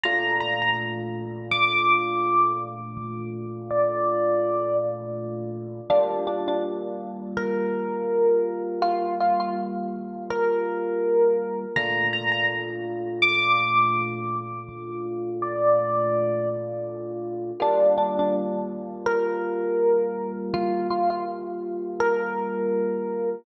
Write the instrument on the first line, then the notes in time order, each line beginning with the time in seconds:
electric piano 1
0.04 A#2 A3 D4 F4 A#5
0.40 A#5
0.62 A#5
1.51 D6
2.97 D6
3.71 D5
5.90 G3 A#3 D4 F4
6.27 D4
6.48 D4
7.37 A#4
8.82 F4
9.20 F4
9.40 F4
10.30 A#4
11.76 A#2 A3 D4 F4 A#5
12.13 A#5
12.32 A#5
13.22 D6
14.69 D6
15.42 D5
17.60 G3 A#3 D4 F4
17.98 D4
18.19 D4
19.06 A#4
20.54 F4
20.90 F4
21.10 F4
22.00 A#4